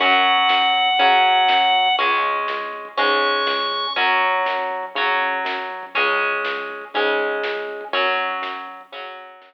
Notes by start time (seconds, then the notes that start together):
0.00 F#2 F#3 C#4 F#5, kick, closed hi-hat
0.13 kick
0.25 kick, closed hi-hat
0.37 kick
0.49 F#2, kick, snare
0.62 kick
0.74 kick, closed hi-hat
0.87 kick
0.99 C#3 F#3 C#4, kick, closed hi-hat
1.12 kick
1.24 kick, closed hi-hat
1.36 kick
1.48 F#2, kick, snare
1.61 kick
1.74 kick, closed hi-hat
1.86 kick
1.98 C#2 G#3 C#4, kick, closed hi-hat
2.11 kick
2.23 kick, closed hi-hat
2.36 kick
2.48 C#2, kick, snare
2.61 kick
2.73 kick, closed hi-hat
2.85 kick
2.97 G#2 G#3 C#4 C#6, kick, closed hi-hat
3.10 kick
3.22 kick, closed hi-hat
3.34 kick
3.46 C#2, kick, snare
3.59 kick
3.72 kick, closed hi-hat
3.84 kick
3.96 F#2 F#3 C#4, kick, closed hi-hat
4.09 kick
4.21 kick, closed hi-hat
4.34 kick
4.46 F#2, kick, snare
4.59 kick
4.70 kick, closed hi-hat
4.83 kick
4.95 C#3 F#3 C#4, kick, closed hi-hat
5.08 kick
5.20 kick, closed hi-hat
5.33 kick
5.45 F#2, kick, snare
5.58 kick
5.70 kick, closed hi-hat
5.83 kick
5.95 C#2 G#3 C#4, kick, closed hi-hat
6.07 kick
6.20 kick, closed hi-hat
6.32 kick
6.45 C#2, kick, snare
6.57 kick
6.70 kick, closed hi-hat
6.81 kick
6.94 G#2 G#3 C#4, kick, closed hi-hat
7.06 kick
7.19 kick, closed hi-hat
7.31 kick
7.43 C#2, kick, snare
7.57 kick
7.69 kick, closed hi-hat
7.81 kick
7.93 F#2 F#3 C#4, kick, closed hi-hat
8.06 kick
8.18 kick, closed hi-hat
8.31 kick
8.42 F#2, kick, snare
8.55 kick
8.68 kick, closed hi-hat
8.81 kick
8.92 C#3 F#3 C#4, kick, closed hi-hat
9.05 kick
9.17 kick, closed hi-hat
9.30 kick
9.41 F#2, kick, snare